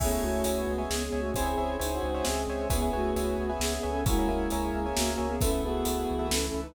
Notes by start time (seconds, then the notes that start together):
0.00 C#2 A3 B3 C#4 E4 G#4 C#5 E5 G#5, kick, crash
0.12 C#5 E5 G#5
0.22 C#2 A3 F#4 C#5 E5 G#5
0.44 C#2 C#4 C#5 E5 G#5, closed hi-hat
0.57 B3
0.67 C#2 G#3 B3 C#4 G#4
0.78 C#5 E5 G#5
0.88 C#2 B3 G#4, snare
1.06 B3 G#4
1.12 C#2 C#5 E5 G#5
1.19 A3 F#4
1.34 C#2 C4 C#4 E4 G#4 C5 C#5 E5 G#5, kick, closed hi-hat
1.46 C5 C#5 E5 G#5
1.58 C#2 C5 C#5 E5 G#5
1.79 C#2 D#4 G#4 C5 C#5 E5 G#5, closed hi-hat
1.92 F#4
2.03 C#2 G#3 C4 C#4 F#4 G#4
2.14 C5 C#5 E5 G#5
2.25 C#2 C4 G#4, snare
2.47 C#2 C5 C#5 E5 G#5
2.70 C#2 B3 C#4 E4 G#4 B4 C#5 E5 G#5, kick, closed hi-hat
2.82 B4 C#5 E5 G#5
2.93 C#2 A3 F#4 B4 C#5 E5 G#5
3.16 C#2 B4 C#5 E5 G#5, closed hi-hat
3.38 C#2 B3 C#4 G#4 B4
3.50 B4 C#5 E5 G#5
3.59 C#2 B3 G#4 E5, snare
3.76 B3 G#4
3.83 C#2 B4 C#5 E5 G#5
3.89 C#4 A4
4.04 C#2 G#3 A#3 C#4 E4 F#4 G#4 A#4 C#5 E5 G#5, kick, closed hi-hat
4.19 A#4 C#5 E5 G#5
4.28 C#2 G#3 E4 A#4 C#5 E5 G#5
4.50 C#2 A#4 C#5 E5 G#5, closed hi-hat
4.62 G#4
4.73 C#2 A#3 C#4 G#4 A#4
4.86 A#4 C#5 E5 G#5
4.95 C#2 A#3 F#4, snare
5.13 A#3 F#4
5.18 C#2 A#4 C#5 E5 G#5
5.28 B3 G#4
5.41 C#2 A3 B3 C#4 E4 A4 B4 E5, kick, closed hi-hat
5.51 A4 B4 E5
5.63 C#2 B3 F#4 G#4 A4 B4 E5
5.85 C#2 A4 B4 E5, closed hi-hat
6.08 C#2 E3 A3 E4
6.19 A4 B4 E5
6.30 C#2 C#4 A4, snare
6.46 C#4 A4
6.54 C#2 A4 B4 E5
6.62 D#4 B4